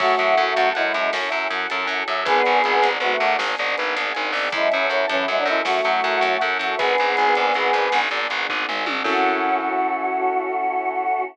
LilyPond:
<<
  \new Staff \with { instrumentName = "Choir Aahs" } { \time 12/8 \key fis \minor \tempo 4. = 106 <a fis'>2 <gis e'>4 r2. | <b gis'>2 <a fis'>4 r2. | <gis e'>8 <e cis'>8 <e cis'>8 <e cis'>8 <gis e'>16 <fis d'>16 <gis e'>8 <a fis'>2~ <a fis'>8 <a fis'>8 | <b gis'>2.~ <b gis'>8 r2 r8 |
fis'1. | }
  \new Staff \with { instrumentName = "Acoustic Grand Piano" } { \time 12/8 \key fis \minor cis''8 e''8 fis''8 a''8 fis''8 e''8 cis''8 e''8 fis''8 a''8 fis''8 e''8 | b'8 d''8 gis''8 d''8 b'8 d''8 gis''8 d''8 b'8 d''8 gis''8 d''8 | cis''8 e''8 fis''8 a''8 fis''8 e''8 cis''8 e''8 fis''8 a''8 fis''8 e''8 | b'8 d''8 gis''8 d''8 b'8 d''8 gis''8 d''8 b'8 d''8 gis''8 d''8 |
<cis' e' fis' a'>1. | }
  \new Staff \with { instrumentName = "Electric Bass (finger)" } { \clef bass \time 12/8 \key fis \minor fis,8 fis,8 fis,8 fis,8 fis,8 fis,8 fis,8 fis,8 fis,8 fis,8 fis,8 fis,8 | gis,,8 gis,,8 gis,,8 gis,,8 gis,,8 gis,,8 gis,,8 gis,,8 gis,,8 gis,,8 gis,,8 gis,,8 | fis,8 fis,8 fis,8 fis,8 fis,8 fis,8 fis,8 fis,8 fis,8 fis,8 fis,8 fis,8 | gis,,8 gis,,8 gis,,8 gis,,8 gis,,8 gis,,8 gis,,8 gis,,8 gis,,8 gis,,8 gis,,8 gis,,8 |
fis,1. | }
  \new Staff \with { instrumentName = "Choir Aahs" } { \time 12/8 \key fis \minor <cis' e' fis' a'>1. | <b d' gis'>1. | <cis' e' fis' a'>1. | <b d' gis'>1. |
<cis' e' fis' a'>1. | }
  \new DrumStaff \with { instrumentName = "Drums" } \drummode { \time 12/8 <cymc bd>8 hh8 hh8 hh8 hh8 hh8 sn8 hh8 hh8 hh8 hh8 hh8 | <hh bd>8 hh8 hh8 hh8 hh8 hh8 sn8 hh8 hh8 hh8 hh8 hho8 | <hh bd>8 hh8 hh8 hh8 hh8 hh8 sn8 hh8 hh8 hh8 hh8 hh8 | <hh bd>8 hh8 hh8 hh8 hh8 hh8 sn8 hh8 hh8 bd8 toml8 tommh8 |
<cymc bd>4. r4. r4. r4. | }
>>